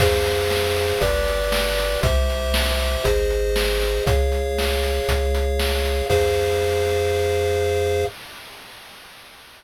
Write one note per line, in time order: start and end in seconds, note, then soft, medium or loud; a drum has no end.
0.00 0.93 F2 loud
0.00 0.99 G#4 medium
0.00 0.99 C5 medium
0.00 0.99 F5 medium
0.00 kick loud
0.00 crash loud
0.26 closed hi-hat loud
0.50 snare loud
0.76 closed hi-hat medium
1.01 1.95 G1 loud
1.01 2.00 G4 medium
1.01 2.00 B4 medium
1.01 2.00 D5 medium
1.01 kick loud
1.01 closed hi-hat loud
1.28 closed hi-hat medium
1.52 snare loud
1.78 closed hi-hat loud
2.03 2.97 C2 loud
2.03 3.03 G4 medium
2.03 3.03 C5 medium
2.03 3.03 E5 medium
2.03 kick loud
2.03 closed hi-hat loud
2.30 closed hi-hat medium
2.54 snare loud
2.79 closed hi-hat medium
3.04 3.99 G#1 loud
3.04 4.04 G#4 medium
3.04 4.04 C5 medium
3.04 4.04 D#5 medium
3.04 kick loud
3.04 closed hi-hat loud
3.30 closed hi-hat medium
3.56 snare loud
3.81 closed hi-hat medium
4.06 5.00 C#2 loud
4.06 6.06 G#4 medium
4.06 6.06 C#5 medium
4.06 6.06 F5 medium
4.06 kick loud
4.06 closed hi-hat loud
4.32 closed hi-hat medium
4.58 snare loud
4.83 closed hi-hat medium
5.08 6.02 C#2 loud
5.08 kick loud
5.08 closed hi-hat loud
5.35 closed hi-hat loud
5.59 snare loud
5.85 closed hi-hat medium
6.10 8.05 F2 loud
6.10 8.04 G#4 loud
6.10 8.04 C5 loud
6.10 8.04 F5 loud
6.10 kick loud
6.10 crash loud